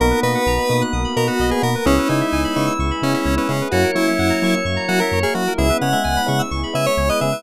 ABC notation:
X:1
M:4/4
L:1/16
Q:1/4=129
K:B
V:1 name="Lead 1 (square)"
A2 B6 z2 A F2 G A2 | C2 D6 z2 C C2 C C2 | F2 E6 z2 F A2 G F2 | e2 f6 z2 e c2 d e2 |]
V:2 name="Drawbar Organ"
B,16 | E16 | c16 | E B,2 G,3 z10 |]
V:3 name="Electric Piano 1"
[A,B,DF]2 [A,B,DF]4 [A,B,DF]4 [A,B,DF]4 [A,B,DF]2 | [G,B,CE]2 [G,B,CE]4 [G,B,CE]4 [G,B,CE]4 [G,B,CE]2 | [F,A,CE]2 [F,A,CE]4 [F,A,CE]4 [F,A,CE]4 [F,A,CE]2 | [G,B,CE]2 [G,B,CE]4 [G,B,CE]4 [G,B,CE]4 [G,B,CE]2 |]
V:4 name="Electric Piano 2"
A B d f a b d' f' d' b a f d B A B | G B c e g b c' e' c' b g e c B G B | F A c e f a c' e' c' a f e c A F A | G B c e g b c' e' c' b g e c B G B |]
V:5 name="Synth Bass 1" clef=bass
B,,,2 B,,2 B,,,2 B,,2 B,,,2 B,,2 B,,,2 B,,2 | C,,2 C,2 C,,2 C,2 C,,2 C,2 C,,2 C,2 | F,,2 F,2 F,,2 F,2 F,,2 F,2 F,,2 F,2 | C,,2 C,2 C,,2 C,2 C,,2 C,2 C,,2 C,2 |]
V:6 name="Pad 2 (warm)"
[A,B,DF]8 [A,B,FA]8 | [G,B,CE]8 [G,B,EG]8 | [F,A,CE]8 [F,A,EF]8 | [G,B,CE]8 [G,B,EG]8 |]